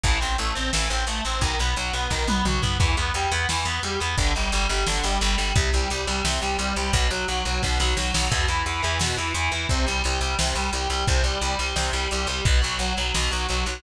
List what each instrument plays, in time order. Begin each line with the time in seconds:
0.03 electric bass (finger) A1, overdriven guitar E3, kick, closed hi-hat
0.20 electric bass (finger) A1, overdriven guitar C4, closed hi-hat
0.38 electric bass (finger) A1, overdriven guitar A3, closed hi-hat
0.55 electric bass (finger) A1, overdriven guitar C4, closed hi-hat
0.73 electric bass (finger) A1, overdriven guitar E3, snare
0.90 electric bass (finger) A1, overdriven guitar C4, closed hi-hat
1.07 electric bass (finger) A1, overdriven guitar A3, closed hi-hat
1.25 electric bass (finger) A1, overdriven guitar C4, closed hi-hat
1.41 electric bass (finger) B1, overdriven guitar D#3, kick, closed hi-hat
1.59 electric bass (finger) B1, overdriven guitar B3, closed hi-hat
1.76 electric bass (finger) B1, overdriven guitar F#3, closed hi-hat
1.93 electric bass (finger) B1, overdriven guitar B3, closed hi-hat
2.10 electric bass (finger) B1, overdriven guitar D#3, kick, snare
2.27 electric bass (finger) B1, overdriven guitar B3, high tom
2.45 electric bass (finger) B1, overdriven guitar F#3, mid tom
2.62 electric bass (finger) B1, overdriven guitar B3, floor tom
2.79 electric bass (finger) E2, overdriven guitar E3, kick, crash
2.97 electric bass (finger) E2, overdriven guitar B3, closed hi-hat
3.14 electric bass (finger) E2, overdriven guitar G3, closed hi-hat
3.32 electric bass (finger) E2, overdriven guitar B3, closed hi-hat
3.49 electric bass (finger) E2, overdriven guitar E3, snare
3.65 electric bass (finger) E2, overdriven guitar B3, closed hi-hat
3.83 electric bass (finger) E2, overdriven guitar G3, closed hi-hat
4.00 electric bass (finger) E2, overdriven guitar B3, closed hi-hat
4.18 electric bass (finger) G1, overdriven guitar D3, kick, closed hi-hat
4.35 electric bass (finger) G1, overdriven guitar G3, closed hi-hat
4.52 electric bass (finger) G1, overdriven guitar G3, closed hi-hat
4.69 electric bass (finger) G1, overdriven guitar G3, closed hi-hat
4.86 electric bass (finger) G1, overdriven guitar D3, snare
5.04 electric bass (finger) G1, overdriven guitar G3, closed hi-hat
5.21 electric bass (finger) G1, overdriven guitar G3, closed hi-hat
5.38 electric bass (finger) G1, overdriven guitar G3, closed hi-hat
5.55 electric bass (finger) C2, overdriven guitar C3, kick, closed hi-hat
5.73 electric bass (finger) C2, overdriven guitar G3, closed hi-hat
5.90 electric bass (finger) C2, overdriven guitar G3, closed hi-hat
6.07 electric bass (finger) C2, overdriven guitar G3, closed hi-hat
6.25 electric bass (finger) C2, overdriven guitar C3, snare
6.41 electric bass (finger) C2, overdriven guitar G3, closed hi-hat
6.59 electric bass (finger) C2, overdriven guitar G3, closed hi-hat
6.76 electric bass (finger) C2, overdriven guitar G3, closed hi-hat
6.93 electric bass (finger) B1, overdriven guitar B2, kick, closed hi-hat
7.10 electric bass (finger) B1, overdriven guitar F#3, closed hi-hat
7.28 electric bass (finger) B1, overdriven guitar F#3, closed hi-hat
7.45 electric bass (finger) B1, overdriven guitar F#3, closed hi-hat
7.62 electric bass (finger) B1, overdriven guitar B2, kick, snare
7.80 electric bass (finger) B1, overdriven guitar F#3, snare
7.97 electric bass (finger) B1, overdriven guitar F#3, snare
8.14 electric bass (finger) B1, overdriven guitar F#3, snare
8.31 electric bass (finger) E2, overdriven guitar B2, kick, crash
8.48 electric bass (finger) E2, overdriven guitar E3, closed hi-hat
8.66 electric bass (finger) E2, overdriven guitar E3, closed hi-hat
8.82 electric bass (finger) E2, overdriven guitar E3, closed hi-hat
8.99 electric bass (finger) E2, overdriven guitar B2, snare
9.17 electric bass (finger) E2, overdriven guitar E3, closed hi-hat
9.34 electric bass (finger) E2, overdriven guitar E3, closed hi-hat
9.52 electric bass (finger) E2, overdriven guitar E3, closed hi-hat
9.69 electric bass (finger) C2, overdriven guitar C3, kick, closed hi-hat
9.86 electric bass (finger) C2, overdriven guitar G3, closed hi-hat
10.04 electric bass (finger) C2, overdriven guitar G3, closed hi-hat
10.21 electric bass (finger) C2, overdriven guitar G3, closed hi-hat
10.39 electric bass (finger) C2, overdriven guitar C3, snare
10.55 electric bass (finger) C2, overdriven guitar G3, closed hi-hat
10.73 electric bass (finger) C2, overdriven guitar G3, closed hi-hat
10.90 electric bass (finger) C2, overdriven guitar G3, closed hi-hat
11.07 electric bass (finger) C2, overdriven guitar C3, kick, closed hi-hat
11.24 electric bass (finger) C2, overdriven guitar G3, closed hi-hat
11.41 electric bass (finger) C2, overdriven guitar G3, closed hi-hat
11.59 electric bass (finger) C2, overdriven guitar G3, closed hi-hat
11.76 electric bass (finger) C2, overdriven guitar C3, snare
11.93 electric bass (finger) C2, overdriven guitar G3, closed hi-hat
12.11 electric bass (finger) C2, overdriven guitar G3, closed hi-hat
12.27 electric bass (finger) C2, overdriven guitar G3, closed hi-hat
12.45 electric bass (finger) B1, overdriven guitar B2, kick, closed hi-hat
12.62 electric bass (finger) B1, overdriven guitar F#3, closed hi-hat
12.79 electric bass (finger) B1, overdriven guitar F#3, closed hi-hat
12.97 electric bass (finger) B1, overdriven guitar F#3, closed hi-hat
13.14 electric bass (finger) B1, overdriven guitar B2, snare
13.31 electric bass (finger) B1, overdriven guitar F#3, closed hi-hat
13.49 electric bass (finger) B1, overdriven guitar F#3, closed hi-hat
13.66 electric bass (finger) B1, overdriven guitar F#3, closed hi-hat